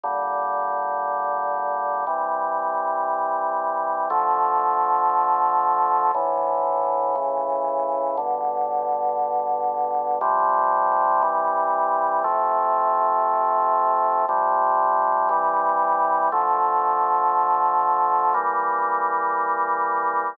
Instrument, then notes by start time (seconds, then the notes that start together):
drawbar organ
0.04 A#2 D3 G3
2.07 C3 E3 G3
4.10 D3 F3 A3
6.15 A2 D3 E3
7.15 A2 C#3 E3
8.17 G2 B2 D3
10.21 C3 F3 G3
11.22 C3 E3 G3
12.24 C3 F3 A3
14.29 C3 F3 G3
15.29 C3 E3 G3
16.32 D3 F3 A3
18.34 E3 G3 A#3